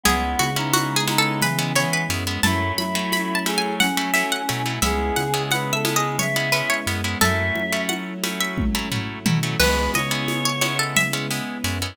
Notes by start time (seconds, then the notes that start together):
0.04 C#2 G#3 B3 C#4 E4 G#4, low conga, shaker
0.39 C#3 F#4, high conga, shaker
0.56 G#3 B3 C#4 D#4 E4
0.73 F#4, high conga, shaker
0.96 G#4
1.08 G#3 B3 C#4 D#4 E4, high conga, shaker
1.18 A4
1.41 E3 B4, low conga, shaker
1.59 G#3 B3 C#4 E4
1.75 E3 G#3 B3 C#4 E4 C#5, shaker
1.93 B4
2.09 F#2 G#3 B3 C#4 E4, shaker
2.27 G#3 B3 C#4 E4
2.43 F#2 F#3 A3 C#4 E4 A5, low conga, shaker
2.78 F#3 E4 B5, high conga, shaker
2.95 F#3 A3 C#4 E4
3.12 B5, high conga, shaker
3.35 A5
3.46 F#3 A3 C#4 E4 G#4, high conga, shaker
3.58 G#5
3.80 C#4 F#5, low conga, shaker
3.97 F#3 A3 C#4 E4
4.14 F#3 A3 C#4 E4 E5, shaker
4.32 F#5
4.49 B2 F#3 A3 C#4 E4, shaker
4.66 F#3 A3 C#4 E4
4.82 C#2 G#3 B3 C#4 E4 G#4 E5, low conga, shaker
5.16 C#3 F#5, high conga, shaker
5.34 G#3 B3 C#4 E4
5.51 B4 F#5, high conga, shaker
5.73 A4 E5
5.85 G#3 B3 C#4 E4, high conga, shaker
5.95 G#4 D#5
6.19 C#5 E5, low conga, shaker
6.36 G#3 B3 C#4 E4
6.52 G#3 B3 C#4 E4 B4, shaker
6.70 C#5
6.87 F#2 G#3 B3 C#4 E4, shaker
7.04 G#3 B3 C#4 E4
7.21 F#2 F#3 A3 C#4 E4 A4 E5, low conga, shaker
7.55 F#3, high conga
7.72 F#3 A3 C#4 E4
7.89 F#5, high conga
8.24 F#3 A3 C#4 E4, high conga, shaker
8.40 E5
8.58 kick, high tom
8.75 F#3 A3 C#4 E4
8.92 F#3 A3 C#4 E4, floor tom
9.26 B2 F#3 A3 C#4 E4, mid tom
9.43 F#3 A3 C#4 E4
9.59 C#2 G#3 B3 C#4 E4 B4, crash, low conga, shaker
9.94 C#3 C#5 D#5, high conga, shaker
10.11 G#3 B3 C#4 E4
10.28 high conga, shaker
10.45 C#5
10.61 G#3 B3 C#4 E4 C#5, high conga, shaker
10.79 A4
10.96 E5, low conga, shaker
11.13 G#3 B3 C#4 E4
11.31 G#3 B3 C#4 E4, shaker
11.64 F#2 G#3 B3 C#4 E4, shaker
11.82 G#3 B3 C#4 E4